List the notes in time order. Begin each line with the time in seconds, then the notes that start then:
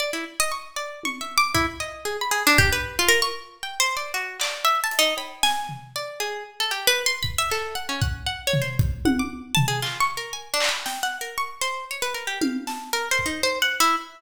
0.00 D5
0.13 E4
0.40 D#5
0.52 C#6
0.76 D5
1.03 C#6, high tom
1.21 E5
1.38 D6
1.55 E4, kick
1.80 D#5
2.05 G#4
2.21 B5
2.31 G#4
2.47 D4
2.58 G4, kick
2.73 B4
2.99 F4
3.09 A#4
3.22 C#6
3.63 G5
3.80 C5
3.97 D5
4.14 F#4
4.40 D5, clap
4.65 E5
4.84 A5
4.91 closed hi-hat
4.99 D#4
5.17 B5, cowbell
5.43 G#5, snare
5.69 floor tom
5.96 D5
6.20 G#4
6.60 A4
6.71 G4
6.87 B4
7.06 C6
7.23 B5, kick
7.38 E5
7.50 A4, clap
7.75 F#5
7.89 C#4
8.02 F#5, kick
8.27 F#5
8.47 C#5
8.53 floor tom
8.62 C5
8.79 kick
9.05 F#5, high tom
9.19 D6
9.55 A5, floor tom
9.68 G#4
9.82 F4, clap
10.00 C#6
10.17 A#4
10.33 G#5
10.54 D4
10.60 clap
10.69 B5
10.86 G5, snare
11.03 F#5
11.21 A#4
11.38 C#6
11.61 C5
11.91 C#5
12.02 B4
12.14 A#4
12.27 G4
12.41 F5, high tom
12.67 A5, snare
12.93 A#4
13.11 C5
13.19 kick
13.26 D#4
13.43 C5
13.62 F#5
13.80 E4